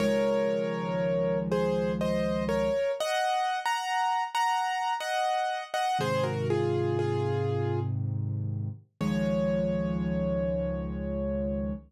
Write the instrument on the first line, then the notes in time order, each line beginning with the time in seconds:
acoustic grand piano
0.00 C#2 D#3 F3 G#3 A#4 C#5
1.51 G#4 C5
2.01 C5 D#5
2.49 A#4 C#5
3.00 D#5 F#5
3.66 F#5 A#5
4.35 F#5 A#5
5.00 D#5 F#5
5.74 D#5 F#5
5.99 G#2 C3 D#3 G#4 C5
6.24 F#4 A#4
6.50 F4 G#4
6.99 F4 G#4
9.01 C#2 D#3 F3 G#3 C#5